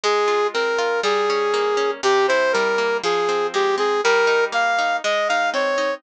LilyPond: <<
  \new Staff \with { instrumentName = "Brass Section" } { \time 2/2 \key f \minor \tempo 2 = 60 aes'4 bes'4 aes'2 | g'8 c''8 bes'4 aes'4 g'8 aes'8 | bes'4 f''4 ees''8 f''8 des''4 | }
  \new Staff \with { instrumentName = "Orchestral Harp" } { \time 2/2 \key f \minor aes8 f'8 c'8 f'8 g8 des'8 bes8 des'8 | c8 e'8 g8 bes8 f8 c'8 aes8 c'8 | g8 ees'8 bes8 ees'8 aes8 ees'8 c'8 ees'8 | }
>>